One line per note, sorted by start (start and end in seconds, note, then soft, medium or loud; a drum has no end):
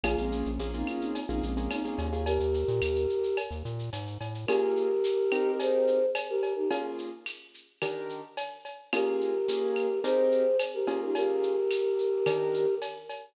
0.03 0.16 A#1 medium
0.03 0.48 A#3 loud
0.03 0.48 C#4 loud
0.03 0.48 F4 loud
0.03 0.17 F4 medium
0.03 0.48 G#4 loud
0.03 0.17 G#4 medium
0.03 cowbell medium
0.03 claves medium
0.03 shaker medium
0.18 0.43 A#1 medium
0.18 0.31 G#3 medium
0.18 0.31 C4 medium
0.18 shaker medium
0.32 0.67 A#3 medium
0.32 0.67 C#4 loud
0.32 shaker medium
0.46 0.59 A#1 medium
0.46 shaker medium
0.59 0.84 A#1 medium
0.59 0.71 A#3 medium
0.59 0.71 C#4 medium
0.59 0.71 F4 medium
0.59 0.71 G#4 medium
0.59 tambourine medium
0.59 shaker medium
0.73 1.18 A#3 medium
0.73 0.87 C4 medium
0.73 1.18 C#4 medium
0.73 0.87 D#4 medium
0.73 1.18 F4 medium
0.73 1.18 G#4 medium
0.73 shaker medium
0.87 1.01 C#4 medium
0.87 1.01 F4 loud
0.87 claves medium
0.87 shaker medium
1.00 1.24 C4 medium
1.00 1.24 D#4 medium
1.00 shaker medium
1.15 cowbell medium
1.15 shaker medium
1.29 1.41 A#1 medium
1.29 1.51 A#3 medium
1.29 1.42 C4 medium
1.29 1.51 C#4 medium
1.29 1.42 D#4 medium
1.29 1.51 F4 medium
1.29 1.51 G#4 medium
1.29 shaker medium
1.43 1.68 A#1 medium
1.43 1.69 G#3 medium
1.43 1.69 C4 medium
1.43 shaker medium
1.57 1.79 A#3 loud
1.57 1.79 C#4 medium
1.57 1.79 F4 medium
1.57 1.79 G#4 medium
1.57 shaker medium
1.71 1.84 C4 medium
1.71 1.84 D#4 medium
1.71 tambourine medium
1.71 cowbell medium
1.71 claves medium
1.71 shaker medium
1.84 2.07 A#3 medium
1.84 1.97 C4 medium
1.84 2.07 C#4 medium
1.84 1.97 D#4 medium
1.84 2.07 F4 medium
1.84 2.07 G#4 medium
1.84 shaker medium
1.98 2.39 D#2 medium
1.98 cowbell medium
1.98 shaker medium
2.12 2.23 A#3 medium
2.12 2.23 C#4 medium
2.12 2.23 F4 medium
2.12 2.23 G#4 loud
2.12 shaker medium
2.26 3.37 G4 medium
2.26 3.37 A#4 loud
2.26 cowbell medium
2.26 shaker medium
2.40 2.65 D#2 medium
2.40 shaker medium
2.54 shaker medium
2.68 2.81 A#2 medium
2.68 shaker medium
2.82 3.07 D#2 medium
2.82 tambourine medium
2.82 claves medium
2.82 shaker loud
2.96 shaker medium
3.09 shaker medium
3.23 shaker medium
3.37 cowbell medium
3.37 claves medium
3.37 shaker medium
3.51 3.63 D#2 medium
3.51 shaker medium
3.65 3.90 A#2 medium
3.65 shaker medium
3.79 shaker medium
3.93 4.18 G#2 medium
3.93 tambourine medium
3.93 cowbell medium
3.93 shaker medium
4.07 shaker medium
4.21 4.46 A2 medium
4.21 cowbell medium
4.21 shaker medium
4.34 shaker medium
4.47 4.87 A#3 medium
4.47 4.87 C#4 loud
4.47 4.87 F4 medium
4.47 5.52 G4 loud
4.47 4.87 G#4 medium
4.47 5.52 A#4 loud
4.47 cowbell medium
4.47 claves medium
4.47 shaker medium
4.76 shaker medium
5.04 tambourine medium
5.04 shaker loud
5.32 5.98 C4 medium
5.32 5.98 D#4 medium
5.32 5.98 G4 medium
5.32 5.98 A#4 medium
5.32 claves medium
5.32 shaker medium
5.59 6.06 G#4 medium
5.59 6.06 C5 medium
5.59 cowbell medium
5.59 shaker loud
5.87 shaker medium
6.15 tambourine medium
6.15 cowbell medium
6.15 claves medium
6.15 shaker loud
6.29 6.54 G4 medium
6.29 6.54 A#4 loud
6.43 cowbell medium
6.43 shaker medium
6.56 6.69 D#4 medium
6.56 6.69 G4 medium
6.71 7.09 A#3 medium
6.71 7.09 C#4 medium
6.71 7.09 F4 loud
6.71 7.09 G#4 medium
6.71 cowbell medium
6.71 shaker medium
6.98 shaker medium
7.26 tambourine medium
7.26 claves medium
7.26 shaker medium
7.54 shaker medium
7.82 8.21 D#3 loud
7.82 8.21 D4 medium
7.82 8.21 G4 medium
7.82 8.21 A#4 medium
7.82 cowbell medium
7.82 claves medium
7.82 shaker medium
8.09 shaker medium
8.37 tambourine medium
8.37 cowbell medium
8.37 shaker medium
8.65 cowbell medium
8.65 shaker medium
8.93 9.32 A#3 medium
8.93 9.32 C#4 medium
8.93 9.32 F4 loud
8.93 10.00 G4 medium
8.93 9.32 G#4 loud
8.93 10.00 A#4 loud
8.93 cowbell medium
8.93 claves loud
8.93 shaker medium
9.21 shaker medium
9.48 9.87 A#3 medium
9.48 9.87 C#4 medium
9.48 9.87 F4 medium
9.48 9.87 G#4 medium
9.48 tambourine medium
9.48 shaker loud
9.76 claves medium
9.76 shaker medium
10.04 10.43 C4 medium
10.04 10.43 D#4 medium
10.04 10.43 G4 medium
10.04 10.57 G#4 medium
10.04 10.43 A#4 medium
10.04 10.57 C5 medium
10.04 cowbell medium
10.04 shaker loud
10.32 shaker medium
10.59 tambourine medium
10.59 cowbell medium
10.59 claves medium
10.59 shaker loud
10.74 11.00 G4 medium
10.74 11.00 A#4 medium
10.87 11.54 A#3 medium
10.87 11.54 C#4 medium
10.87 11.54 F4 loud
10.87 11.54 G#4 medium
10.87 cowbell medium
10.87 shaker medium
11.03 11.16 D#4 medium
11.03 11.15 G4 medium
11.15 12.75 G4 loud
11.15 12.75 A#4 loud
11.15 cowbell medium
11.15 shaker medium
11.43 shaker medium
11.71 tambourine medium
11.71 claves medium
11.71 shaker loud
11.98 shaker medium
12.26 12.65 D#3 medium
12.26 12.65 D4 medium
12.26 12.65 G4 medium
12.26 12.65 A#4 medium
12.26 cowbell medium
12.26 claves medium
12.26 shaker medium
12.54 shaker medium
12.82 tambourine medium
12.82 cowbell medium
12.82 shaker medium
13.09 cowbell medium
13.09 shaker medium